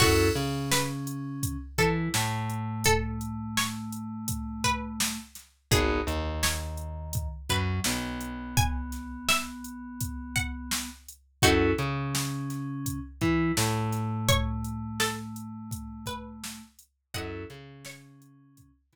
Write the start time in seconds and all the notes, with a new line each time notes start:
0.00 F#2 C#4 E4 F#4 A4, kick, crash
0.35 C#3 C#4, closed hi-hat
0.71 B4, snare
1.07 closed hi-hat
1.43 kick, closed hi-hat
1.78 E3 E4 A4, kick, closed hi-hat
2.14 A2 A3, snare
2.50 closed hi-hat
2.84 A4, kick, closed hi-hat
3.21 closed hi-hat
3.57 C#5, snare
3.92 closed hi-hat
4.28 kick, closed hi-hat
4.64 B4, kick, closed hi-hat
5.00 snare
5.35 snare, closed hi-hat
5.71 G#1 B3 D#4 F#4 G#4, kick, closed hi-hat
6.07 D#2 D#3, closed hi-hat
6.43 C#5, snare
6.77 closed hi-hat
7.13 kick, closed hi-hat
7.49 F#2 F#3 B4, kick, closed hi-hat
7.84 B1 B3, snare
8.21 closed hi-hat
8.57 G#5, kick, closed hi-hat
8.92 snare, closed hi-hat
9.29 E5, snare
9.64 closed hi-hat
10.01 kick, closed hi-hat
10.36 F#5, kick, closed hi-hat
10.71 snare
11.08 closed hi-hat
11.42 F#2 C#4 D#4 E4 F#4 A4, kick, closed hi-hat
11.78 C#3 C#4, closed hi-hat
12.15 snare
12.50 snare, closed hi-hat
12.86 kick, closed hi-hat
13.21 E3 E4, kick, closed hi-hat
13.57 A2 A3, snare
13.93 snare, closed hi-hat
14.29 C#5, kick, closed hi-hat
14.64 closed hi-hat
15.00 A4, snare
15.36 closed hi-hat
15.71 kick, closed hi-hat
16.06 B4, kick, closed hi-hat
16.44 snare
16.79 closed hi-hat
17.14 F#2 C#4 E4 F#4 A4 D#5 F#5, kick, closed hi-hat
17.50 C#3 C#4, closed hi-hat
17.85 C#5, snare
18.22 closed hi-hat
18.57 kick, closed hi-hat
18.93 E3 E4, kick, snare, closed hi-hat